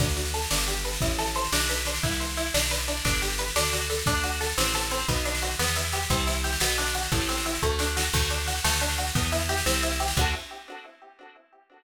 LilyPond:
<<
  \new Staff \with { instrumentName = "Acoustic Guitar (steel)" } { \time 6/8 \key d \mixolydian \tempo 4. = 118 d'8 fis'8 a'8 d'8 g'8 b'8 | e'8 a'8 c''8 d'8 b'8 d'8 | e'8 c''8 e'8 d'8 b'8 d'8 | d'8 g'8 b'8 d'8 fis'8 a'8 |
d'8 fis'8 a'8 c'8 a'8 c'8 | b8 d'8 fis'8 b8 e'8 g'8 | c'8 e'8 g'8 b8 d'8 fis'8 | a8 c'8 e'8 a8 d'8 fis'8 |
a8 d'8 fis'8 a8 d'8 fis'8 | b8 e'8 g'8 c'8 e'8 g'8 | <d' fis' a'>4. r4. | }
  \new Staff \with { instrumentName = "Electric Bass (finger)" } { \clef bass \time 6/8 \key d \mixolydian d,4. g,,4. | a,,4. b,,4. | c,4. b,,4. | g,,4. d,4. |
d,4. a,,4. | b,,4. e,4. | c,4. b,,4. | a,,4. d,4. |
d,4. d,4. | e,4. c,4. | d,4. r4. | }
  \new DrumStaff \with { instrumentName = "Drums" } \drummode { \time 6/8 <bd sn>16 sn16 sn16 sn16 sn16 sn16 sn16 sn16 sn16 sn16 sn16 sn16 | <bd sn>16 sn16 sn16 sn16 sn16 sn16 sn16 sn16 sn16 sn16 sn16 sn16 | <bd sn>16 sn16 sn16 sn16 sn16 sn16 sn16 sn16 sn16 sn16 sn16 sn16 | <bd sn>16 sn16 sn16 sn16 sn16 sn16 sn16 sn16 sn16 sn16 sn16 sn16 |
<bd sn>16 sn16 sn16 sn16 sn16 sn16 sn16 sn16 sn16 sn16 sn16 sn16 | <bd sn>16 sn16 sn16 sn16 sn16 sn16 sn16 sn16 sn16 sn16 sn16 sn16 | <bd sn>16 sn16 sn16 sn16 sn16 sn16 sn16 sn16 sn16 sn16 sn16 sn16 | <bd sn>16 sn16 sn16 sn16 sn16 sn16 bd8 sn8 sn8 |
<cymc bd sn>16 sn16 sn16 sn16 sn16 sn16 sn16 sn16 sn16 sn16 sn16 sn16 | <bd sn>16 sn16 sn16 sn16 sn16 sn16 sn16 sn16 sn16 sn16 sn16 sn16 | <cymc bd>4. r4. | }
>>